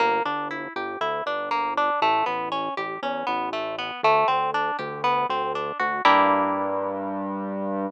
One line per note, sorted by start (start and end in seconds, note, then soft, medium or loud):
0.00 0.21 G1 medium
0.00 0.23 A#3 loud
0.25 0.68 G1 medium
0.25 0.48 D4 medium
0.51 0.73 E4 medium
0.76 0.97 G1 medium
0.76 0.99 G4 medium
1.01 1.22 D2 medium
1.01 1.24 E4 medium
1.26 1.90 G1 medium
1.26 1.49 D4 medium
1.51 1.74 A#3 medium
1.77 2.00 D4 medium
2.02 2.23 A1 medium
2.02 2.25 A3 loud
2.26 2.70 A1 medium
2.26 2.49 B3 medium
2.52 2.74 C#4 medium
2.77 2.99 A1 medium
2.77 3.00 G4 medium
3.02 3.24 E2 medium
3.02 3.26 C#4 medium
3.27 3.92 A1 medium
3.27 3.49 B3 medium
3.53 3.76 A3 medium
3.79 4.01 B3 medium
4.03 4.25 D2 medium
4.03 4.27 A3 loud
4.28 4.71 D2 medium
4.28 4.51 C4 medium
4.54 4.77 D4 medium
4.79 5.26 D2 medium
4.79 5.01 G4 medium
5.04 5.27 B3 loud
5.29 5.72 D2 medium
5.29 5.53 C4 medium
5.55 5.78 D4 medium
5.80 6.01 D2 medium
5.80 6.02 F#4 medium
6.05 7.90 G2 loud
6.05 7.90 A#3 loud
6.05 7.90 D4 loud
6.05 7.90 E4 loud
6.05 7.90 G4 medium